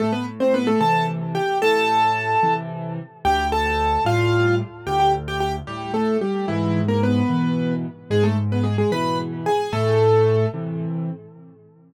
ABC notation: X:1
M:6/8
L:1/16
Q:3/8=74
K:Am
V:1 name="Acoustic Grand Piano"
[A,A] [B,B] z [Cc] [B,B] [A,A] [Aa]2 z2 [Gg]2 | [Aa]8 z4 | [Gg]2 [Aa]4 [Ff]4 z2 | [Gg] [Gg] z [Gg] [Gg] z [G,G]2 [A,A]2 [G,G]2 |
[E,E]3 [_B,^A] [=B,B]6 z2 | [^G,^G] [A,A] z [B,B] [G,G] [G,G] [Bb]2 z2 [G^g]2 | [A,A]6 z6 |]
V:2 name="Acoustic Grand Piano" clef=bass
A,,6 [C,E,]6 | A,,6 [C,E,]6 | D,,6 [A,,G,]6 | D,,6 A,,6 |
^G,,6 [B,,E,]6 | ^G,,6 [B,,E,]6 | A,,6 [C,E,]6 |]